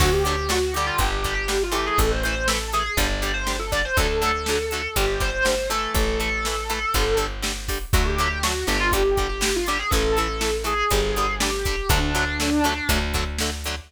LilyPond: <<
  \new Staff \with { instrumentName = "Distortion Guitar" } { \time 4/4 \key d \major \tempo 4 = 121 fis'16 g'16 g'8 fis'8 g'16 f'16 g'8. g'8 f'16 g'16 gis'16 | a'16 c''16 c''8 a'8 gis'16 gis'16 d''8. c''8 a'16 d''16 c''16 | a'2 g'8 c''4 a'8 | a'2~ a'8 r4. |
fis'16 g'16 g'8 fis'8 g'16 f'16 g'8. g'8 f'16 g'16 gis'16 | a'4. aes'4. g'4 | d'2~ d'8 r4. | }
  \new Staff \with { instrumentName = "Acoustic Guitar (steel)" } { \time 4/4 \key d \major <d fis a>8 <d fis a>8 <d fis a>8 <d g>4 <d g>8 <d g>8 <e a>8~ | <e a>8 <e a>8 <e a>8 <e a>8 <d g>8 <d g>8 <d g>8 <d g>8 | <d fis a>8 <d fis a>8 <d fis a>8 <d fis a>8 <d g>8 <d g>8 <d g>8 <e a>8~ | <e a>8 <e a>8 <e a>8 <e a>8 <d g>8 <d g>8 <d g>8 <d g>8 |
<d fis a>8 <d fis a>8 <d fis a>8 <d fis a>8 <d g>8 <d g>8 <d g>8 <d g>8 | <e a>8 <e a>8 <e a>8 <e a>8 <d g>8 <d g>8 <d g>8 <d g>8 | <d fis a>8 <d fis a>8 <d fis a>8 <d fis a>8 <d fis a>8 <d fis a>8 <d fis a>8 <d fis a>8 | }
  \new Staff \with { instrumentName = "Electric Bass (finger)" } { \clef bass \time 4/4 \key d \major d,2 g,,2 | a,,2 g,,2 | d,2 g,,2 | a,,2 g,,2 |
d,4. g,,2~ g,,8 | a,,2 g,,2 | d,2 d,2 | }
  \new DrumStaff \with { instrumentName = "Drums" } \drummode { \time 4/4 <cymc bd>8 hh8 sn8 hh8 <hh bd>8 <hh bd>8 sn8 hh8 | <hh bd>8 hh8 sn8 hh8 <hh bd>8 hh8 sn8 <hh bd>8 | <hh bd>8 hh8 sn8 hh8 <hh bd>8 <hh bd>8 sn8 hh8 | <hh bd>8 hh8 sn8 hh8 <hh bd>8 hh8 sn8 <hho bd>8 |
<hh bd>8 hh8 sn8 hh8 <hh bd>8 <hh bd>8 sn8 hh8 | <hh bd>8 hh8 sn8 hh8 <hh bd>8 hh8 sn8 <hh bd>8 | <hh bd>8 hh8 sn8 hh8 <hh bd>8 <hh bd>8 sn8 hh8 | }
>>